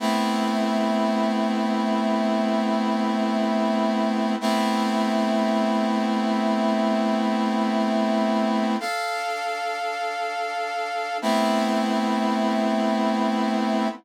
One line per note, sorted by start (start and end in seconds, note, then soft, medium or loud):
0.00 4.36 A3 loud
0.00 4.36 B3 loud
0.00 4.36 C4 medium
0.00 4.36 E4 medium
4.41 8.76 A3 loud
4.41 8.76 B3 loud
4.41 8.76 C4 loud
4.41 8.76 E4 medium
8.80 11.18 D4 medium
8.80 11.18 A4 loud
8.80 11.18 F5 loud
11.22 13.88 A3 loud
11.22 13.88 B3 loud
11.22 13.88 C4 loud
11.22 13.88 E4 loud